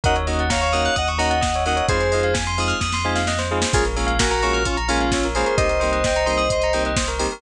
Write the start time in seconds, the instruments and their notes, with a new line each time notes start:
0.03 synth bass 2 D#2, electric piano 2 A#3 C#4 D#4 F#4 D#5 F#5, tubular bells A#4, kick, closed hi-hat
0.16 tubular bells C#5, closed hi-hat
0.27 electric piano 2 A#3 C#4 D#4 F#4, tubular bells D#5, open hi-hat
0.39 tubular bells F#5, closed hi-hat
0.50 electric piano 2 C#5 F5, tubular bells A#5, kick, snare
0.61 electric piano 2 C#5 F5, tubular bells C#6, closed hi-hat
0.73 electric piano 2 A#3 C#4 D#4 F#4, tubular bells D#6, open hi-hat
0.85 tubular bells F#6, closed hi-hat
0.96 synth bass 2 D#2, electric piano 2 D#5 F#5, tubular bells D#6, kick, closed hi-hat
1.08 tubular bells C#6, closed hi-hat
1.17 electric piano 2 A#3 C#4 D#4 F#4 D#5 F#5, tubular bells A#5, open hi-hat
1.30 tubular bells F#5, closed hi-hat
1.41 tubular bells D#5, kick, snare
1.54 tubular bells C#5, closed hi-hat
1.65 electric piano 2 A#3 C#4 D#4 F#4 D#5 F#5, tubular bells A#4, open hi-hat
1.76 tubular bells C#5, closed hi-hat
1.88 synth bass 2 F2, electric piano 2 G#3 C4 D#4 F4 G#4 C5, tubular bells G#4, kick, closed hi-hat
2.00 tubular bells C5, closed hi-hat
2.12 electric piano 2 G#3 C4 D#4 F4, tubular bells D#5, open hi-hat
2.23 tubular bells F5, closed hi-hat
2.34 tubular bells G#5, kick, snare
2.47 tubular bells C6, closed hi-hat
2.57 electric piano 2 G#3 C4 D#4 F4, tubular bells D#6, open hi-hat
2.68 tubular bells F6, closed hi-hat
2.80 synth bass 2 F2, tubular bells D#6, kick, snare
2.92 tubular bells C6, snare
3.04 electric piano 2 G#3 C4 D#4 F4, tubular bells G#5
3.15 tubular bells F5, snare
3.27 tubular bells D#5, snare
3.38 tubular bells C5, snare
3.51 electric piano 2 G#3 C4 D#4 F4, tubular bells G#4
3.62 tubular bells C5, snare
3.73 synth bass 2 A#1, electric piano 2 G#3 A#3 C#4 F4 G#4, tubular bells G#4, kick, crash
3.85 tubular bells A#4, closed hi-hat
3.96 electric piano 2 G#3 A#3 C#4 F4, tubular bells C#5, open hi-hat
4.07 tubular bells F5, closed hi-hat
4.19 electric piano 2 F#4 A#4, tubular bells G#5, kick, snare
4.30 electric piano 2 F#4 A#4, tubular bells A#5, closed hi-hat
4.42 electric piano 2 G#3 A#3 C#4 F4, tubular bells C#6, open hi-hat
4.53 tubular bells F6, closed hi-hat
4.65 electric piano 2 C#4 F4, tubular bells C#6, kick, closed hi-hat
4.77 tubular bells A#5, closed hi-hat
4.88 electric piano 2 G#3 A#3 C#4 F4, tubular bells G#5, open hi-hat
5.00 tubular bells F5, closed hi-hat
5.11 tubular bells C#5, kick, snare
5.23 tubular bells A#4, closed hi-hat
5.35 electric piano 2 G#3 A#3 C#4 F4 G#4 C5, tubular bells G#4, open hi-hat
5.46 tubular bells A#4, closed hi-hat
5.57 synth bass 2 C2, electric piano 2 G3 A#3 C4 D#4 C5 D#5, tubular bells G4, kick, closed hi-hat
5.69 tubular bells A#4, closed hi-hat
5.80 electric piano 2 G3 A#3 C4 D#4, tubular bells C5, open hi-hat
5.92 tubular bells D#5, closed hi-hat
6.04 tubular bells G5, kick, snare
6.16 tubular bells A#5, closed hi-hat
6.26 electric piano 2 G3 A#3 C4 D#4, tubular bells C6, open hi-hat
6.37 tubular bells D#6, closed hi-hat
6.50 tubular bells C6, kick, closed hi-hat
6.62 tubular bells A#5, closed hi-hat
6.73 electric piano 2 G3 A#3 C4 D#4, tubular bells G5, open hi-hat
6.85 tubular bells D#5, closed hi-hat
6.96 tubular bells C5, kick, snare
7.08 tubular bells A#4, closed hi-hat
7.19 electric piano 2 G3 A#3 C4 D#4, tubular bells G4, open hi-hat
7.31 tubular bells A#4, open hi-hat